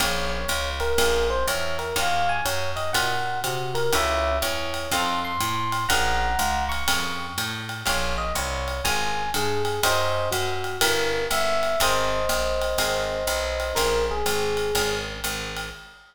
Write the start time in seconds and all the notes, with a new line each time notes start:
0.00 A#1 A#3 C#4 F4 G#4 C#5, kick, ride
0.29 C#5
0.48 C#2, hi-hat pedal, ride
0.80 A#4, ride
0.98 A#1 A#3 C#4 F4 G#4, kick, ride
1.30 C5
1.47 E2 C#5, hi-hat pedal, ride
1.79 A#4, ride
1.96 D#2 C#4 D#4 F4 F#4 F5, kick, ride
2.29 G#5
2.45 F#2 C#5, hi-hat pedal, ride
2.76 D#5, ride
2.93 A#2 C#4 D#4 F4 F#4 F#5, kick, ride
3.44 C3 F#4, hi-hat pedal, ride
3.75 A#4, ride
3.93 C#2 C#4 E4 F#4 A4 C#5 E5, kick, ride
4.42 E2 C#5, hi-hat pedal, ride
4.74 ride
4.91 F2 C4 D#4 F4 A4 C6, kick, ride
5.24 C6
5.40 A2 C6, hi-hat pedal, ride
5.72 ride
5.89 A#1 C#4 F4 G#4 A#4 F#5 A#5, kick, ride
6.39 C#2, hi-hat pedal, ride
6.69 C#6, ride
6.88 F2 C#4 F4 G#4 A#4, kick, ride
7.38 A2, hi-hat pedal, ride
7.69 ride
7.86 A#1 C#4 F4 G#4 A#4 C#5, kick, ride
8.18 D#5
8.35 C2 C#5, hi-hat pedal, ride
8.68 ride
8.84 G#1 C#4 F4 G#4 A#4 G#5, kick, ride
9.34 G2 G#4, hi-hat pedal, ride
9.65 G#4, ride
9.83 F#2 C#4 D#4 F#4 A#4 C5 D#5, kick, ride
10.31 F#2 F#4, hi-hat pedal, ride
10.64 ride
10.81 G1 C#4 E4 G4 A#4, kick, ride
11.31 G1 E5, hi-hat pedal, ride
11.63 ride
11.80 G#1 C4 D#4 G#4 A#4 C5 D#5, kick, ride
12.29 A#1, hi-hat pedal, ride
12.62 ride
12.78 G#1 C4 D#4 G#4 A#4, kick, ride
13.27 B1, hi-hat pedal, ride
13.60 ride
13.75 A#1 C#4 F4 G#4 A#4, kick, ride
14.11 G#4
14.26 G#1, hi-hat pedal, ride
14.57 ride
14.75 G#1 C#4 F4 G#4 A#4, kick, ride
15.24 G#1, hi-hat pedal, ride
15.57 ride